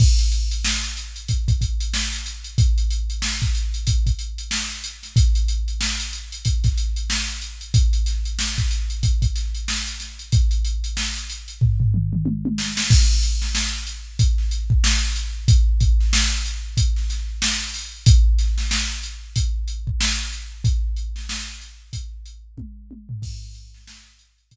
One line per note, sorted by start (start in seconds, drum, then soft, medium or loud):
0.00 kick loud
0.00 crash medium
0.19 closed hi-hat medium
0.32 closed hi-hat medium
0.51 closed hi-hat medium
0.65 snare loud
0.83 closed hi-hat medium
0.97 closed hi-hat medium
1.16 closed hi-hat medium
1.28 kick medium
1.28 closed hi-hat medium
1.48 kick medium
1.48 closed hi-hat medium
1.61 kick medium
1.61 closed hi-hat medium
1.80 closed hi-hat medium
1.94 snare loud
2.12 snare soft
2.12 closed hi-hat medium
2.26 closed hi-hat medium
2.44 closed hi-hat medium
2.58 kick loud
2.58 closed hi-hat medium
2.78 closed hi-hat medium
2.91 closed hi-hat medium
3.10 closed hi-hat medium
3.22 snare loud
3.42 kick medium
3.42 closed hi-hat medium
3.55 closed hi-hat medium
3.74 closed hi-hat medium
3.87 kick medium
3.87 closed hi-hat loud
4.06 kick medium
4.06 closed hi-hat medium
4.19 closed hi-hat medium
4.38 closed hi-hat medium
4.51 snare loud
4.70 closed hi-hat medium
4.84 closed hi-hat medium
5.03 snare soft
5.03 closed hi-hat medium
5.16 kick loud
5.16 closed hi-hat loud
5.35 closed hi-hat medium
5.48 closed hi-hat medium
5.68 closed hi-hat medium
5.81 snare loud
6.00 closed hi-hat medium
6.13 closed hi-hat medium
6.32 closed hi-hat medium
6.45 kick medium
6.45 closed hi-hat loud
6.64 kick medium
6.64 snare soft
6.64 closed hi-hat medium
6.78 closed hi-hat medium
6.96 closed hi-hat medium
7.10 snare loud
7.28 closed hi-hat medium
7.42 closed hi-hat medium
7.61 closed hi-hat medium
7.74 kick loud
7.74 closed hi-hat loud
7.93 closed hi-hat medium
8.06 snare soft
8.06 closed hi-hat medium
8.25 closed hi-hat medium
8.39 snare loud
8.57 kick medium
8.57 snare soft
8.57 closed hi-hat medium
8.71 snare soft
8.71 closed hi-hat medium
8.90 closed hi-hat medium
9.03 kick medium
9.03 closed hi-hat medium
9.22 kick medium
9.22 closed hi-hat medium
9.35 snare soft
9.35 closed hi-hat medium
9.55 closed hi-hat medium
9.68 snare loud
9.87 closed hi-hat medium
10.00 snare soft
10.00 closed hi-hat medium
10.19 closed hi-hat medium
10.32 kick loud
10.32 closed hi-hat loud
10.51 closed hi-hat medium
10.65 closed hi-hat medium
10.84 closed hi-hat medium
10.97 snare loud
11.16 closed hi-hat medium
11.30 closed hi-hat medium
11.48 closed hi-hat medium
11.61 kick medium
11.61 floor tom medium
11.80 floor tom medium
11.94 mid tom medium
12.13 mid tom medium
12.26 high tom medium
12.45 high tom medium
12.58 snare medium
12.77 snare loud
12.90 kick loud
12.90 crash loud
13.23 closed hi-hat medium
13.42 snare medium
13.55 snare loud
13.87 closed hi-hat medium
14.19 kick loud
14.19 closed hi-hat loud
14.38 snare soft
14.51 closed hi-hat medium
14.70 kick medium
14.84 snare loud
15.16 snare soft
15.16 closed hi-hat medium
15.48 kick loud
15.48 closed hi-hat loud
15.80 kick medium
15.80 closed hi-hat medium
16.00 snare soft
16.13 snare loud
16.46 closed hi-hat medium
16.77 kick medium
16.77 closed hi-hat loud
16.96 snare soft
17.10 snare soft
17.10 closed hi-hat medium
17.42 snare loud
17.74 open hi-hat medium
18.06 kick loud
18.06 closed hi-hat loud
18.39 snare soft
18.39 closed hi-hat medium
18.58 snare medium
18.71 snare loud
19.03 closed hi-hat medium
19.36 kick medium
19.36 closed hi-hat loud
19.68 closed hi-hat medium
19.87 kick medium
20.01 snare loud
20.33 closed hi-hat medium
20.64 kick loud
20.64 closed hi-hat loud
20.97 closed hi-hat medium
21.16 snare medium
21.29 snare loud
21.61 closed hi-hat medium
21.93 kick medium
21.93 closed hi-hat loud
22.26 closed hi-hat medium
22.58 kick medium
22.58 high tom medium
22.91 high tom medium
23.09 floor tom loud
23.22 kick loud
23.22 crash loud
23.54 closed hi-hat medium
23.74 snare medium
23.87 snare loud
24.19 closed hi-hat medium
24.38 closed hi-hat medium
24.51 kick medium
24.51 closed hi-hat loud